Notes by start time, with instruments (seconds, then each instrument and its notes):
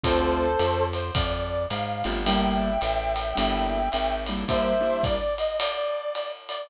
0.03 electric bass (finger) D2, acoustic grand piano A3 C4 D4 F4, brass section A4 C5, kick, ride
0.59 electric bass (finger) F2, hi-hat pedal, ride
0.93 brass section C5, ride
1.15 electric bass (finger) F2, brass section D5, kick, ride
1.70 electric bass (finger) G#2, brass section F5, hi-hat pedal, ride
2.04 electric bass (finger) G1, acoustic grand piano A3 C4 D4 F4, ride
2.25 acoustic grand piano G3 A#3 D4 E4, brass section E5 G5, ride
2.81 electric bass (finger) A1, hi-hat pedal, ride
3.16 ride
3.35 electric bass (finger) G1, acoustic grand piano G3 A#3 D4 E4, ride
3.92 electric bass (finger) G#1, hi-hat pedal, ride
4.26 acoustic grand piano G3 A#3 D4 E4, ride
4.48 acoustic grand piano G3 A#3 D4 E4, brass section C5 E5, kick, ride
4.80 acoustic grand piano G3 A#3 D4 E4
5.03 brass section D5, kick, hi-hat pedal, ride
5.38 brass section D#5, ride
5.59 brass section D5, ride
6.15 hi-hat pedal, ride
6.49 brass section D5, ride